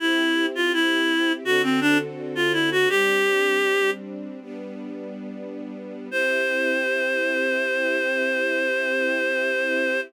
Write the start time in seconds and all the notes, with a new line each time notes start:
0.00 C4 E4 G4
0.55 F4
0.73 E4
1.44 D3 C4 F#4 A4
1.63 C4
1.81 D4
2.35 F4
2.53 E4
2.72 F#4
2.89 G3 C4 D4 G4
4.41 G3 B3 D4
6.10 C4 E4 G4 C5